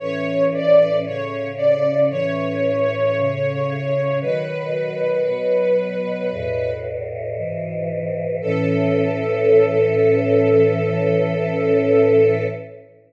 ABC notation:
X:1
M:4/4
L:1/8
Q:1/4=57
K:A
V:1 name="String Ensemble 1"
c d c d c4 | B5 z3 | A8 |]
V:2 name="Choir Aahs"
[A,,E,C]2 [A,,C,C]2 [A,,E,C]2 [A,,C,C]2 | [B,,^D,F,]2 [B,,F,B,]2 [E,,A,,B,,]2 [G,,B,,E,]2 | [A,,E,C]8 |]